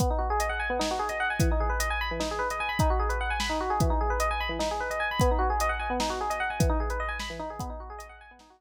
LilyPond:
<<
  \new Staff \with { instrumentName = "Electric Piano 1" } { \time 7/8 \key b \mixolydian \tempo 4 = 150 b16 dis'16 fis'16 gis'16 dis''16 fis''16 gis''16 b16 dis'16 fis'16 gis'16 dis''16 fis''16 gis''16 | e16 dis'16 gis'16 b'16 dis''16 gis''16 b''16 e16 dis'16 gis'16 b'16 dis''16 gis''16 b''16 | \time 5/8 dis'16 fis'16 gis'16 b'16 fis''16 gis''16 b''16 dis'16 fis'16 gis'16 | \time 7/8 e16 dis'16 gis'16 b'16 dis''16 gis''16 b''16 e16 dis'16 gis'16 b'16 dis''16 gis''16 b''16 |
b16 dis'16 fis'16 gis'16 dis''16 fis''16 gis''16 b16 dis'16 fis'16 gis'16 dis''16 fis''16 gis''16 | \time 5/8 e16 dis'16 gis'16 b'16 dis''16 gis''16 b''16 e16 dis'16 gis'16 | \time 7/8 b16 dis'16 fis'16 gis'16 dis''16 fis''16 gis''16 b16 dis'16 fis'16 gis'16 r8. | }
  \new DrumStaff \with { instrumentName = "Drums" } \drummode { \time 7/8 <hh bd>4 hh4 sn8. hh8. | <hh bd>4 hh4 sn8. hh8. | \time 5/8 <hh bd>8. hh8. sn4 | \time 7/8 <hh bd>4 hh4 sn8. hh8. |
<hh bd>4 hh4 sn8. hh8. | \time 5/8 <hh bd>8. hh8. sn4 | \time 7/8 <hh bd>4 hh4 sn4. | }
>>